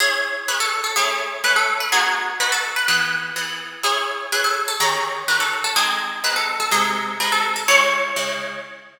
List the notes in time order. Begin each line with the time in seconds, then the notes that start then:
0.00 C#4 E4 G#4
0.48 C#4 E4 G#4 B4
0.60 A4
0.84 A4
0.96 A3 C#4 E4 G#4
1.44 A3 C#4 E4 B4
1.56 A4
1.80 B4
1.92 B3 D#4 F#4 G#4
2.40 B3 D#4 F#4 B4
2.52 A4
2.76 B4
2.88 E3 B3 G#4 B4
3.36 E3 B3 G#4
3.83 C#4 E4 G#4
4.32 C#4 E4 G#4 B4
4.44 A4
4.68 A4
4.80 D#3 C#4 G4 G#4 A#4
5.28 D#3 C#4 G4 A#4 B4
5.40 A4
5.64 A4
5.76 G#3 C4 D#4 G#4
6.24 G#3 C4 D#4 B4
6.36 A4
6.60 A4
6.71 C3 G#3 D#4 G#4
7.20 C3 G#3 D#4 B4
7.32 A4
7.56 A4
7.68 C#3 G#3 E4 C#5
8.16 C#3 G#3 E4